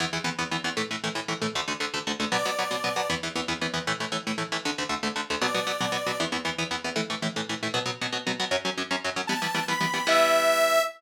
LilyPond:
<<
  \new Staff \with { instrumentName = "Lead 2 (sawtooth)" } { \time 6/8 \key e \dorian \tempo 4. = 155 r2. | r2. | r2. | d''2. |
r2. | r2. | r2. | d''2. |
r2. | r2. | r2. | r2. |
a''4. b''4. | e''2. | }
  \new Staff \with { instrumentName = "Overdriven Guitar" } { \time 6/8 \key e \dorian <e, e b>8 <e, e b>8 <e, e b>8 <e, e b>8 <e, e b>8 <e, e b>8 | <a, e a>8 <a, e a>8 <a, e a>8 <a, e a>8 <a, e a>8 <a, e a>8 | <d, d a>8 <d, d a>8 <d, d a>8 <d, d a>8 <d, d a>8 <d, d a>8 | <b, fis b>8 <b, fis b>8 <b, fis b>8 <b, fis b>8 <b, fis b>8 <b, fis b>8 |
<e, e b>8 <e, e b>8 <e, e b>8 <e, e b>8 <e, e b>8 <e, e b>8 | <a, e a>8 <a, e a>8 <a, e a>8 <a, e a>8 <a, e a>8 <a, e a>8 | <d, d a>8 <d, d a>8 <d, d a>8 <d, d a>8 <d, d a>8 <d, d a>8 | <b, fis b>8 <b, fis b>8 <b, fis b>8 <b, fis b>8 <b, fis b>8 <b, fis b>8 |
<e, e b>8 <e, e b>8 <e, e b>8 <e, e b>8 <e, e b>8 <e, e b>8 | <a, e a>8 <a, e a>8 <a, e a>8 <a, e a>8 <a, e a>8 <a, e a>8 | <b, fis b>8 <b, fis b>8 <b, fis b>8 <b, fis b>8 <b, fis b>8 <b, fis b>8 | <fis, fis cis'>8 <fis, fis cis'>8 <fis, fis cis'>8 <fis, fis cis'>8 <fis, fis cis'>8 <fis, fis cis'>8 |
<e g b>8 <e g b>8 <e g b>8 <e g b>8 <e g b>8 <e g b>8 | <e g b>2. | }
>>